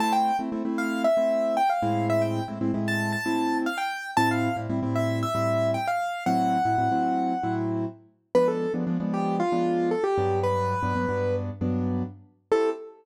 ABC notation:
X:1
M:4/4
L:1/16
Q:1/4=115
K:Am
V:1 name="Acoustic Grand Piano"
a g2 z3 f2 e4 g f3 | e g2 z3 a2 a4 f g3 | a f2 z3 e2 e4 g f3 | ^f10 z6 |
B A2 z3 G2 F4 A G3 | B8 z8 | A4 z12 |]
V:2 name="Acoustic Grand Piano"
[A,CE]3 [A,CE] [A,CE] [A,CE]4 [A,CE]5 [A,,^G,CE]2- | [A,,^G,CE]3 [A,,G,CE] [A,,G,CE] [A,,G,CE]4 [A,,G,CE]7 | [A,,G,CE]3 [A,,G,CE] [A,,G,CE] [A,,G,CE]4 [A,,G,CE]7 | [A,,^F,CE]3 [A,,F,CE] [A,,F,CE] [A,,F,CE]4 [A,,F,CE]7 |
[F,_A,B,D]3 [F,A,B,D] [F,A,B,D] [F,A,B,D]4 [F,A,B,D]5 [G,,^F,B,D]2- | [G,,^F,B,D]3 [G,,F,B,D] [G,,F,B,D] [G,,F,B,D]4 [G,,F,B,D]7 | [A,CEG]4 z12 |]